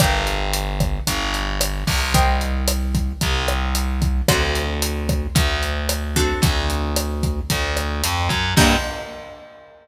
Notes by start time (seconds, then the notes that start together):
0.00 G1 A#4 D5 F5 G5, kick, cross-stick, closed hi-hat
0.27 closed hi-hat
0.53 closed hi-hat
0.80 kick, cross-stick, closed hi-hat
1.07 G1, kick, closed hi-hat
1.34 closed hi-hat
1.61 cross-stick, closed hi-hat
1.87 C2, kick, open hi-hat
2.14 A#4 C5 D#5 G5, kick, closed hi-hat
2.41 closed hi-hat
2.68 cross-stick, closed hi-hat
2.95 kick, closed hi-hat
3.21 C2, kick, closed hi-hat
3.48 cross-stick, closed hi-hat
3.75 closed hi-hat
4.02 kick, closed hi-hat
4.28 D2 C4 D4 F#4 A4, kick, cross-stick, closed hi-hat
4.55 closed hi-hat
4.82 closed hi-hat
5.09 kick, cross-stick, closed hi-hat
5.35 D2, kick, closed hi-hat
5.63 closed hi-hat
5.89 cross-stick, closed hi-hat
6.16 C4 D4 F#4 A4, kick, closed hi-hat
6.42 D2, kick, closed hi-hat
6.70 closed hi-hat
6.96 cross-stick, closed hi-hat
7.23 kick, closed hi-hat
7.50 D2, kick, closed hi-hat
7.77 cross-stick, closed hi-hat
8.04 F2, closed hi-hat
8.29 F#2, kick, closed hi-hat
8.56 G2 A#3 D4 F4 G4, kick, crash